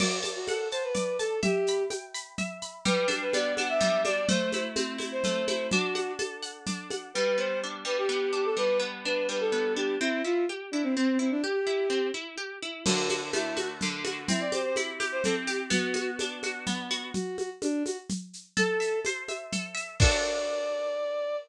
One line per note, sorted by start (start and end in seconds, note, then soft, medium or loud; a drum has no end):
0.00 0.19 F#4 medium
0.00 0.94 D5 loud
0.00 crash loud
0.00 low conga medium
0.00 shaker medium
0.23 0.72 A5 medium
0.23 high conga medium
0.23 shaker medium
0.36 0.47 F#4 medium
0.48 0.68 A4 medium
0.48 1.39 F#5 medium
0.48 high conga medium
0.48 shaker medium
0.71 0.83 C5 medium
0.71 1.19 A5 medium
0.71 shaker medium
0.83 1.17 B4 medium
0.94 1.40 D5 medium
0.94 low conga medium
0.94 shaker medium
1.19 1.40 A4 loud
1.19 1.42 A5 medium
1.19 shaker medium
1.43 1.83 G4 loud
1.43 2.38 E5 loud
1.43 low conga loud
1.43 shaker medium
1.67 2.14 B5 medium
1.67 shaker medium
1.90 2.81 G5 medium
1.90 high conga medium
1.90 shaker medium
2.14 2.62 B5 medium
2.14 shaker medium
2.38 2.83 E5 medium
2.38 low conga medium
2.38 shaker medium
2.62 2.85 B5 medium
2.62 shaker medium
2.85 3.80 G3 loud
2.85 3.07 B4 loud
2.85 low conga loud
2.85 shaker medium
3.08 3.57 D4 medium
3.08 high conga medium
3.08 shaker medium
3.21 3.33 B4 medium
3.33 4.24 B3 medium
3.33 3.54 D5 loud
3.33 high conga medium
3.33 shaker medium
3.57 4.05 D4 medium
3.57 3.68 F#5 medium
3.57 high conga medium
3.57 shaker medium
3.69 4.01 E5 medium
3.80 4.26 G3 loud
3.80 low conga medium
3.80 shaker medium
4.05 4.28 D4 medium
4.05 4.28 D5 loud
4.05 high conga medium
4.05 shaker medium
4.29 5.24 A3 loud
4.29 4.50 C5 medium
4.29 low conga loud
4.29 shaker medium
4.52 4.98 E4 medium
4.52 4.64 C5 medium
4.52 high conga medium
4.52 shaker medium
4.76 5.67 C4 medium
4.76 high conga medium
4.76 shaker medium
4.98 5.47 E4 medium
4.98 high conga medium
4.98 shaker medium
5.12 5.45 C5 loud
5.24 5.70 A3 medium
5.24 low conga medium
5.24 shaker medium
5.48 5.70 E4 medium
5.48 5.67 C5 medium
5.48 high conga medium
5.48 shaker medium
5.71 6.66 D4 medium
5.71 6.12 F#4 loud
5.71 low conga loud
5.71 shaker medium
5.95 6.42 F#5 medium
5.95 high conga medium
5.95 shaker medium
6.19 7.09 A4 medium
6.19 high conga medium
6.19 shaker medium
6.42 6.91 F#5 medium
6.42 shaker medium
6.66 7.12 D4 medium
6.66 low conga medium
6.66 shaker medium
6.90 7.14 F#5 medium
6.90 high conga medium
6.90 shaker medium
7.14 7.84 G3 medium
7.14 7.37 B4 loud
7.37 8.08 B3 medium
7.37 7.59 C5 medium
7.63 8.32 D4 medium
7.85 8.56 G3 medium
7.85 7.97 B4 loud
7.98 8.09 G4 loud
8.09 8.79 B3 medium
8.09 8.31 G4 loud
8.33 9.05 D4 medium
8.33 8.45 G4 loud
8.45 8.57 A4 loud
8.56 9.28 G3 medium
8.56 8.78 B4 loud
8.79 9.52 B3 medium
9.05 9.76 D4 medium
9.05 9.27 B4 medium
9.29 9.96 G3 medium
9.29 9.40 B4 medium
9.40 9.73 A4 loud
9.52 9.97 B3 medium
9.76 9.99 D4 medium
9.76 9.95 G4 medium
10.00 10.22 C4 loud
10.00 10.22 E4 loud
10.24 10.46 E4 medium
10.24 10.44 F4 medium
10.49 10.71 G4 medium
10.71 10.83 D4 loud
10.71 10.94 E4 medium
10.83 10.95 C4 medium
10.95 11.18 C4 medium
11.19 11.30 C4 medium
11.19 11.40 E4 medium
11.31 11.42 D4 loud
11.43 12.07 G4 loud
11.43 11.65 G4 medium
11.66 11.88 E4 medium
11.90 12.11 C4 medium
12.14 12.36 E4 medium
12.37 12.59 G4 medium
12.62 12.84 E4 medium
12.86 13.82 D3 loud
12.86 13.09 F#4 loud
12.86 crash loud
12.86 low conga loud
12.86 shaker medium
13.09 13.21 F#4 medium
13.09 13.56 F#4 medium
13.09 high conga medium
13.09 shaker medium
13.33 14.24 A3 medium
13.33 13.54 E4 loud
13.33 high conga medium
13.33 shaker medium
13.57 14.04 F#4 medium
13.57 13.68 F#4 loud
13.57 high conga medium
13.57 shaker medium
13.81 14.27 D3 medium
13.81 low conga medium
13.81 shaker medium
14.04 14.27 F#4 medium
14.04 high conga medium
14.04 shaker medium
14.28 15.25 C4 loud
14.28 14.40 E4 loud
14.28 low conga loud
14.28 shaker medium
14.40 14.52 D5 medium
14.52 14.99 G4 medium
14.52 14.64 C5 medium
14.52 high conga medium
14.52 shaker medium
14.64 14.76 C5 medium
14.76 15.67 E4 medium
14.76 high conga medium
14.76 shaker medium
15.00 15.47 G4 medium
15.00 high conga medium
15.00 shaker medium
15.12 15.23 C5 loud
15.24 15.70 C4 medium
15.24 15.35 A4 loud
15.24 low conga medium
15.24 shaker medium
15.47 15.70 G4 medium
15.47 15.59 G4 medium
15.47 shaker medium
15.70 16.66 B3 loud
15.70 16.10 F#4 loud
15.70 low conga medium
15.70 shaker medium
15.94 16.43 F#4 medium
15.94 high conga medium
15.94 shaker medium
16.19 17.11 D4 medium
16.19 high conga medium
16.19 shaker medium
16.43 16.90 F#4 medium
16.43 high conga medium
16.43 shaker medium
16.67 17.12 B3 loud
16.67 low conga medium
16.67 shaker medium
16.90 17.13 F#4 loud
16.90 shaker medium
17.14 17.37 F#4 loud
17.14 low conga medium
17.14 shaker medium
17.38 17.49 F#4 loud
17.38 high conga medium
17.38 shaker medium
17.62 17.83 D4 loud
17.62 high conga medium
17.62 shaker medium
17.86 17.97 F#4 medium
17.86 high conga medium
17.86 shaker medium
18.09 low conga medium
18.09 shaker medium
18.33 shaker medium
18.57 19.52 A4 loud
18.57 18.99 A4 loud
18.57 low conga medium
18.57 shaker medium
18.80 19.28 E5 medium
18.80 shaker medium
19.05 19.96 C5 medium
19.05 high conga medium
19.05 shaker medium
19.28 19.74 E5 medium
19.28 high conga medium
19.28 shaker medium
19.52 19.98 A4 medium
19.52 low conga medium
19.52 shaker medium
19.75 19.97 E5 medium
19.75 shaker medium
20.00 21.36 D4 medium
20.00 21.36 F#4 loud
20.00 21.36 A4 loud
20.00 21.36 D5 loud
20.00 kick loud
20.00 crash loud